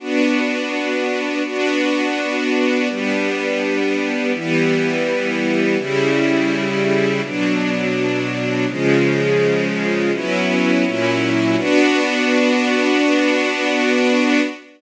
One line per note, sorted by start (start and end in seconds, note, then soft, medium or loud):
0.00 1.43 B3 medium
0.00 1.43 D4 medium
0.00 1.43 F#4 medium
1.45 2.88 B3 medium
1.45 2.88 D4 medium
1.45 2.88 F#4 medium
2.89 4.32 G3 medium
2.89 4.32 B3 medium
2.89 4.32 D4 medium
4.34 5.77 E3 medium
4.34 5.77 G3 medium
4.34 5.77 B3 medium
5.78 7.21 C#3 medium
5.78 7.21 G3 medium
5.78 7.21 E4 medium
7.23 8.66 B2 medium
7.23 8.66 F#3 medium
7.23 8.66 D4 medium
8.68 10.11 C#3 medium
8.68 10.11 F3 medium
8.68 10.11 G#3 medium
10.13 10.84 F#3 medium
10.13 10.84 B3 medium
10.13 10.84 C#4 medium
10.13 10.84 E4 medium
10.84 11.56 A#2 medium
10.84 11.56 F#3 medium
10.84 11.56 C#4 medium
10.84 11.56 E4 medium
11.57 14.41 B3 loud
11.57 14.41 D4 loud
11.57 14.41 F#4 medium